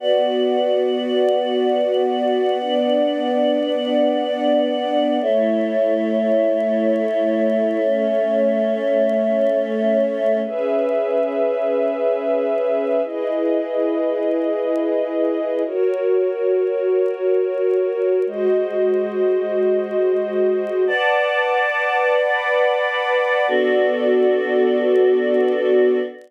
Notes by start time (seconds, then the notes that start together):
0.00 B3 F#4 B4 D5 F#5
2.60 B3 D4 D5
5.21 A3 E4 A4 C#5 E5
7.83 A3 C#4 C#5
10.44 C#4 G#4 B4 E5
13.04 E4 G#4 B4 D#5
15.65 F#4 A#4 C#5
18.26 G#3 F#4 C5 D#5
20.87 B4 D5 F#5 A5 D6
22.18 B4 F#5 B5 D6
23.48 B3 D4 F#4 A4 D5